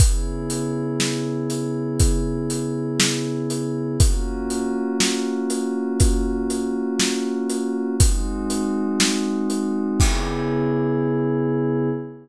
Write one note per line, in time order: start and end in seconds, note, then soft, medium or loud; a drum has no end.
0.00 3.97 C#3 medium
0.00 3.97 B3 medium
0.00 3.97 E4 medium
0.00 3.97 G#4 medium
0.00 kick loud
0.00 closed hi-hat loud
0.50 closed hi-hat medium
1.00 snare loud
1.50 closed hi-hat medium
2.00 kick loud
2.00 closed hi-hat loud
2.50 closed hi-hat medium
3.00 snare loud
3.50 closed hi-hat medium
3.99 7.95 A#3 medium
3.99 7.95 C#4 medium
3.99 7.95 F4 medium
3.99 7.95 F#4 medium
3.99 kick loud
3.99 closed hi-hat loud
4.50 closed hi-hat medium
5.00 snare loud
5.50 closed hi-hat medium
6.00 kick loud
6.00 closed hi-hat loud
6.50 closed hi-hat medium
7.00 snare loud
7.50 closed hi-hat medium
8.00 9.98 G#3 medium
8.00 9.98 C4 medium
8.00 9.98 D#4 loud
8.00 9.98 F#4 medium
8.00 kick loud
8.00 closed hi-hat loud
8.50 closed hi-hat medium
9.00 snare loud
9.50 closed hi-hat medium
9.99 11.89 C#3 loud
9.99 11.89 B3 loud
9.99 11.89 E4 medium
9.99 11.89 G#4 loud
9.99 kick loud
9.99 crash loud